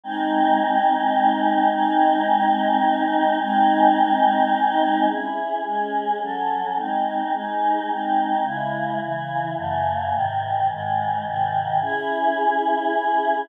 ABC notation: X:1
M:9/8
L:1/8
Q:3/8=107
K:C#m
V:1 name="Choir Aahs"
[G,^B,D]9 | [G,^B,D]9 | [G,^B,D]9 | [CEG]3 [G,CG]3 [F,CA]3 |
[G,^B,D]3 [G,DG]3 [G,B,D]3 | [C,G,E]3 [C,E,E]3 [F,,C,A,]3 | [G,,^B,,D,]3 [G,,D,G,]3 [G,,B,,D,]3 | [CEG]9 |]